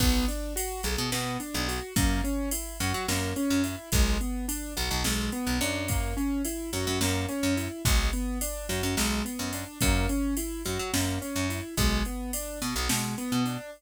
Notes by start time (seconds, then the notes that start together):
0.00 B1 B3, kick, crash
0.28 D4, ride
0.56 F#4, ride
0.83 B1 G#4, ride
0.98 B2
1.12 B2 B3, snare
1.40 D4, ride
1.54 B1
1.68 F#4, ride
1.96 F#2 A#3, kick, ride
2.24 C#4, ride
2.51 E4, ride
2.80 F#2 F#4, ride
2.94 F#3
3.08 F#2 A#3, snare
3.36 C#4, ride
3.50 F#2
3.64 E4, ride
3.92 B1 G#3, kick, ride
4.21 B3, ride
4.48 D4, ride
4.77 B1 F#4, ride
4.91 B1
5.04 B1 G#3, snare
5.32 B3, ride
5.47 B1
5.61 F#2 D4, ride
5.88 A#3, kick, ride
6.17 C#4, ride
6.45 E4, ride
6.73 F#2 F#4, ride
6.87 F#2
7.01 F#2 A#3, snare
7.29 C#4, ride
7.43 F#2
7.57 E4, ride
7.85 B1 G#3, kick, ride
8.13 B3, ride
8.41 D4, ride
8.69 F#2 F#4, ride
8.83 F#2
8.97 B1 G#3, snare
9.25 B3, ride
9.39 F#2
9.53 D4, ride
9.81 F#2 A#3, kick, ride
10.09 C#4, ride
10.37 E4, ride
10.65 F#2 F#4, ride
10.79 F#3
10.93 F#2 A#3, snare
11.21 C#4, ride
11.36 F#2
11.50 E4, ride
11.77 B1 G#3, kick, ride
12.05 B3, ride
12.33 D4, ride
12.62 B2 F#4, ride
12.76 B1
12.89 B2 G#3, snare
13.18 B3, ride
13.32 B2
13.46 D4, ride